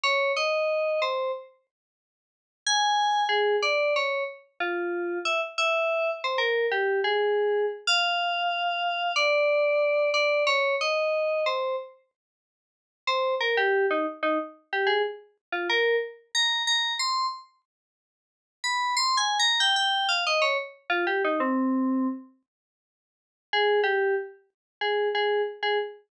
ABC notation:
X:1
M:4/4
L:1/16
Q:1/4=92
K:Fm
V:1 name="Electric Piano 2"
d2 e4 c2 z8 | a4 A2 =d2 _d2 z2 F4 | =e z e4 c B2 G2 A4 z | f8 =d6 d2 |
d2 e4 c2 z8 | c2 B G2 E z E z2 G A z3 F | B2 z2 b2 b2 c'2 z6 | z2 =b2 (3c'2 a2 _b2 g g2 f e d z2 |
F G E C5 z8 | A2 G2 z4 A2 A2 z A z2 |]